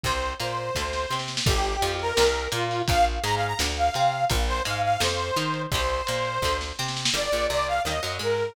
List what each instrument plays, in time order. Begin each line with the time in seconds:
0.04 electric bass (finger) C2, acoustic guitar (steel) C3 G3, lead 2 (sawtooth) C5, kick, closed hi-hat
0.23 closed hi-hat
0.40 electric bass (finger) A#2, acoustic guitar (steel) A#3, lead 2 (sawtooth) C5, closed hi-hat
0.57 closed hi-hat
0.75 electric bass (finger) D2, acoustic guitar (steel) D3 A3, kick, snare
0.93 snare
1.10 electric bass (finger) C3, acoustic guitar (steel) C4, snare
1.19 snare
1.28 snare
1.37 snare
1.46 electric bass (finger) G1, acoustic guitar (steel) D3 G3, lead 2 (sawtooth) G4, kick, crash
1.65 closed hi-hat
1.82 electric bass (finger) F2, acoustic guitar (steel) F3, closed hi-hat
1.99 lead 2 (sawtooth) A#4, closed hi-hat
2.17 electric bass (finger) C2, acoustic guitar (steel) C3 G3, snare
2.34 closed hi-hat
2.52 electric bass (finger) A#2, acoustic guitar (steel) A#3, lead 2 (sawtooth) F4, closed hi-hat
2.71 open hi-hat
2.88 electric bass (finger) A#1, acoustic guitar (steel) A#2 F3, lead 2 (sawtooth) F5, kick, closed hi-hat
3.05 closed hi-hat
3.23 electric bass (finger) G#2, acoustic guitar (steel) G#3, lead 2 (sawtooth) A#5, closed hi-hat
3.36 lead 2 (sawtooth) F5
3.41 closed hi-hat
3.47 lead 2 (sawtooth) A#5
3.59 electric bass (finger) D2, acoustic guitar (steel) A2 D3, snare
3.77 lead 2 (sawtooth) F5, closed hi-hat
3.94 electric bass (finger) C3, acoustic guitar (steel) C4, closed hi-hat
4.12 closed hi-hat
4.30 electric bass (finger) A#1, acoustic guitar (steel) A#2 F3, kick, closed hi-hat
4.48 lead 2 (sawtooth) C5, closed hi-hat
4.65 electric bass (finger) G#2, acoustic guitar (steel) G#3, lead 2 (sawtooth) F5, closed hi-hat
4.83 lead 2 (sawtooth) F5, closed hi-hat
5.00 electric bass (finger) F2, acoustic guitar (steel) C3 F3, lead 2 (sawtooth) C5, snare
5.20 closed hi-hat
5.36 electric bass (finger) D#3, acoustic guitar (steel) D#4, closed hi-hat
5.54 closed hi-hat
5.72 electric bass (finger) C2, acoustic guitar (steel) C3 G3, lead 2 (sawtooth) C5, kick, closed hi-hat
5.89 closed hi-hat
6.07 electric bass (finger) A#2, acoustic guitar (steel) A#3, closed hi-hat
6.25 closed hi-hat
6.42 electric bass (finger) D2, acoustic guitar (steel) D3 A3, kick, snare
6.61 snare
6.79 electric bass (finger) C3, acoustic guitar (steel) C4, snare
6.88 snare
6.97 snare
7.05 snare
7.13 electric bass (finger) G1, acoustic guitar (steel) D3 G3, lead 2 (sawtooth) D5
7.32 electric bass (finger) A#1, acoustic guitar (steel) A#2
7.50 electric bass (finger) C2, acoustic guitar (steel) C3, lead 2 (sawtooth) D5
7.68 lead 2 (sawtooth) F5
7.85 electric bass (finger) D#2, acoustic guitar (steel) D#3 G3 A#3, lead 2 (sawtooth) D#5
8.03 electric bass (finger) F#2, acoustic guitar (steel) F#3
8.19 electric bass (finger) G#2, acoustic guitar (steel) G#3, lead 2 (sawtooth) A#4